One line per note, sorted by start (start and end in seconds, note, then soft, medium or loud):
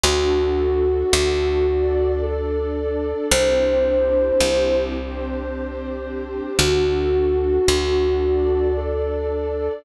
0.03 1.04 D2 medium
0.03 1.66 D4 medium
0.03 1.66 F#4 loud
0.03 2.11 F#4 medium
0.03 1.66 A4 loud
1.13 3.14 D2 loud
1.67 3.29 D4 loud
1.67 3.29 A4 medium
1.67 3.29 D5 loud
2.22 3.26 A4 medium
3.31 4.32 C2 loud
3.31 4.93 C4 loud
3.31 4.93 D4 loud
3.31 4.93 E4 loud
3.31 4.93 G4 loud
3.31 4.76 C5 medium
4.40 6.41 C2 medium
4.95 6.57 C4 loud
4.95 6.57 D4 loud
4.95 6.57 G4 loud
4.95 6.57 C5 loud
6.58 7.59 D2 medium
6.58 8.20 D4 medium
6.58 8.20 F#4 loud
6.58 8.68 F#4 medium
6.58 8.20 A4 loud
7.68 9.69 D2 medium
8.22 9.84 D4 loud
8.22 9.84 A4 medium
8.22 9.84 D5 medium
8.77 9.73 A4 medium